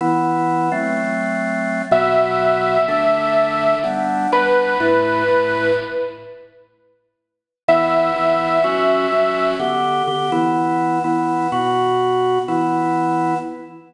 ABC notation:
X:1
M:4/4
L:1/8
Q:1/4=125
K:Em
V:1 name="Lead 2 (sawtooth)"
z8 | e8 | z2 B6 | z8 |
e8 | z8 | z8 |]
V:2 name="Drawbar Organ"
[E,B,E]3 [F,A,C]5 | [B,,F,B,]4 [D,A,D]4 | [G,B,D]2 [G,B,D]2 [A,,A,E]2 [A,,A,E]2 | z8 |
[E,B,E]2 [E,B,E]2 [F,^CF]2 [F,CF]2 | [D,B,G]2 [D,B,G] [E,B,E]3 [E,B,E]2 | [B,,B,F]4 [E,B,E]4 |]